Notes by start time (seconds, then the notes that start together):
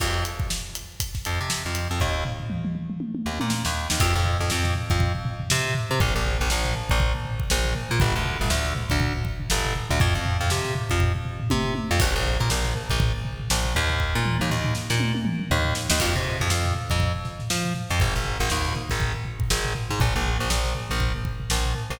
0.00 F2, kick, crash
0.25 closed hi-hat
0.40 kick
0.50 snare
0.75 closed hi-hat
1.00 kick, closed hi-hat
1.15 kick, snare
1.25 F2, closed hi-hat
1.41 C3
1.50 snare
1.66 F2
1.75 closed hi-hat
1.91 F2
2.00 D#2, kick, floor tom
2.25 floor tom
2.40 floor tom
2.50 mid tom
2.65 mid tom
2.75 mid tom
2.90 mid tom
3.00 high tom
3.15 high tom
3.26 D#2
3.40 A#2, high tom
3.50 snare
3.65 D#2, snare
3.90 D#2, snare
4.00 F2, kick, crash
4.15 F2, floor tom
4.25 floor tom
4.40 F2, floor tom
4.50 F2, snare
4.65 snare, floor tom
4.75 floor tom
4.90 F2, kick, snare, floor tom
5.00 kick, floor tom
5.15 floor tom
5.25 floor tom
5.40 floor tom
5.50 C3, snare
5.65 floor tom
5.75 floor tom
5.90 C3, floor tom
6.00 A#1, kick, floor tom
6.15 A#1, floor tom
6.25 floor tom
6.40 A#1, floor tom
6.50 A#1, snare
6.64 snare, floor tom
6.75 floor tom
6.89 A#1, kick, floor tom
7.00 kick, floor tom
7.15 floor tom
7.25 floor tom
7.40 kick, floor tom
7.50 A#1, snare
7.65 floor tom
7.75 floor tom
7.90 A#2, floor tom
8.00 G1, kick, floor tom
8.15 D2, floor tom
8.25 floor tom
8.40 G1, floor tom
8.50 D2, snare
8.65 snare, floor tom
8.75 floor tom
8.90 D2, kick, snare, floor tom
9.00 kick, floor tom
9.15 floor tom
9.25 kick, floor tom
9.40 floor tom
9.50 G1, snare
9.65 floor tom
9.75 floor tom
9.89 D2, floor tom
10.00 F2, kick, floor tom
10.15 F2, kick, floor tom
10.25 floor tom
10.40 F2, floor tom
10.50 C3, snare
10.65 snare, floor tom
10.75 floor tom
10.90 F2, kick, floor tom
11.00 kick, floor tom
11.15 floor tom
11.25 floor tom
11.40 floor tom
11.50 C3, kick, high tom
11.65 floor tom
11.75 high tom
11.91 F2
12.00 A#1, kick, crash
12.15 A#1, floor tom
12.25 snare, floor tom
12.39 A#2, snare, floor tom
12.50 A#1, snare
12.64 snare, floor tom
12.75 floor tom
12.90 A#1, kick, floor tom
13.00 kick, floor tom
13.14 floor tom
13.25 floor tom
13.40 floor tom
13.50 A#1, snare
13.64 floor tom
13.75 D#2, floor tom
13.90 floor tom
14.00 kick
14.15 A#2
14.25 mid tom
14.40 D#2, mid tom
14.50 D#2, floor tom
14.64 floor tom
14.75 snare
14.90 A#2, snare
15.00 high tom
15.15 high tom
15.25 mid tom
15.40 mid tom
15.50 D#2, floor tom
15.65 floor tom
15.75 snare
15.90 D#2, snare
16.00 F2, kick, crash
16.15 C3, floor tom
16.25 floor tom
16.40 F2, floor tom
16.50 F2, snare
16.64 snare, floor tom
16.75 floor tom
16.90 F2, kick, floor tom
17.00 kick, floor tom
17.15 floor tom
17.25 snare, floor tom
17.39 snare, floor tom
17.50 F3, snare
17.64 snare, floor tom
17.75 snare, floor tom
17.90 F2, snare, floor tom
18.00 G#1, kick, floor tom
18.15 G#1, snare, floor tom
18.25 floor tom
18.40 G#1, snare, floor tom
18.50 D#2, snare
18.64 snare, floor tom
18.75 snare, floor tom
18.90 G#1, kick, floor tom
19.00 kick, floor tom
19.14 floor tom
19.25 floor tom
19.39 kick, floor tom
19.50 G#1, snare
19.65 floor tom
19.75 floor tom
19.90 G#2, floor tom
20.00 A#1, kick, floor tom
20.15 A#1, snare, floor tom
20.25 floor tom
20.40 A#1, floor tom
20.50 A#1, snare
20.65 snare, floor tom
20.75 floor tom
20.90 A#1, floor tom
21.00 kick, floor tom
21.14 floor tom
21.25 kick, floor tom
21.40 floor tom
21.50 A#1, snare
21.65 floor tom
21.75 floor tom
21.90 A#1, floor tom